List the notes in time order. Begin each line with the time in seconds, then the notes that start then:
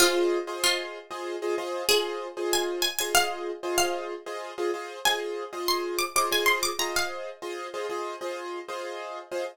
0.00 F4 G#4 C5 D#5
0.47 F4 G#4 C5 D#5
0.64 F4
1.11 F4 G#4 C5 D#5
1.42 F4 G#4 C5 D#5
1.58 F4 G#4 C5 D#5
1.89 F4 G#4 C5 D#5
2.37 F4 G#4 C5 D#5
2.53 G#5
2.82 G#5
2.99 F4 G#4 C5 D#5 G#5
3.15 F5
3.63 F4 G#4 C5 D#5
3.78 F5
4.26 F4 G#4 C5 D#5
4.58 F4 G#4 C5 D#5
4.74 F4 G#4 C5 D#5
5.05 F4 G#4 C5 D#5 G#5
5.53 F4 G#4 C5 D#5
5.68 C6
5.99 D6
6.16 F4 G#4 C5 D#5 D6
6.31 F4 G#4 C5 D#5 G#5
6.46 C6
6.63 D6
6.79 F4 G#4 C5 D#5 A#5
6.96 F5
7.42 F4 G#4 C5 D#5
7.74 F4 G#4 C5 D#5
7.89 F4 G#4 C5 D#5
8.21 F4 G#4 C5 D#5
8.68 F4 G#4 C5 D#5
9.31 F4 G#4 C5 D#5